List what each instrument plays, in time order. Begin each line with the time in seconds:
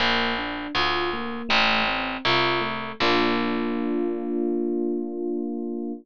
0.00 harpsichord A#1, electric piano 1 A#3
0.38 electric piano 1 D4
0.75 harpsichord D2, electric piano 1 F4
1.13 electric piano 1 A#3
1.49 harpsichord A1, electric piano 1 A3
1.88 electric piano 1 C4
2.25 harpsichord C2, electric piano 1 F4
2.61 electric piano 1 A3
3.00 harpsichord A#1, electric piano 1 A#3 D4 F4